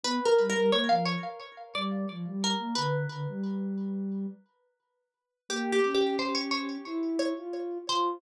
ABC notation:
X:1
M:4/4
L:1/16
Q:1/4=88
K:G
V:1 name="Pizzicato Strings"
(3B2 _B2 B2 ^c =f c4 d4 B2 | B8 z8 | (3G2 G2 G2 c ^c c4 _d4 =c2 |]
V:2 name="Ocarina"
B, z G, G, _B, =F,2 z3 G,2 F, G,2 B, | D,2 D, G,7 z6 | _B,2 ^C6 E3 =F3 F2 |]